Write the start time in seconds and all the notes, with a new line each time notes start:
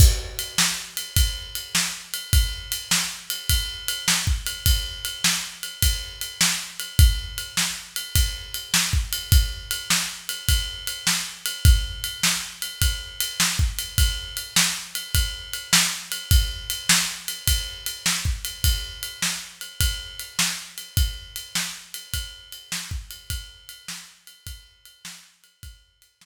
0.00 kick, crash
0.39 ride
0.58 snare
0.97 ride
1.17 kick, ride
1.55 ride
1.75 snare
2.14 ride
2.33 kick, ride
2.72 ride
2.91 snare
3.30 ride
3.50 kick, ride
3.88 ride
4.08 snare
4.27 kick
4.46 ride
4.66 kick, ride
5.05 ride
5.24 snare
5.63 ride
5.82 kick, ride
6.21 ride
6.41 snare
6.80 ride
6.99 kick, ride
7.38 ride
7.57 snare
7.96 ride
8.16 kick, ride
8.54 ride
8.74 snare
8.93 kick
9.13 ride
9.32 kick, ride
9.71 ride
9.90 snare
10.29 ride
10.49 kick, ride
10.87 ride
11.07 snare
11.46 ride
11.65 kick, ride
12.04 ride
12.23 snare
12.62 ride
12.82 kick, ride
13.21 ride
13.40 snare
13.59 kick
13.79 ride
13.98 kick, ride
14.37 ride
14.56 snare
14.95 ride
15.15 kick, ride
15.53 ride
15.73 snare
16.12 ride
16.31 kick, ride
16.70 ride
16.89 snare
17.28 ride
17.48 kick, ride
17.86 ride
18.06 snare
18.25 kick
18.45 ride
18.64 kick, ride
19.03 ride
19.22 snare
19.61 ride
19.80 kick, ride
20.20 ride
20.39 snare
20.78 ride
20.97 kick, ride
21.36 ride
21.55 snare
21.94 ride
22.14 kick, ride
22.52 ride
22.72 snare
22.91 kick
23.11 ride
23.30 kick, ride
23.69 ride
23.88 snare
24.27 ride
24.47 kick, ride
24.85 ride
25.05 snare
25.44 ride
25.63 kick, ride
26.02 ride
26.21 snare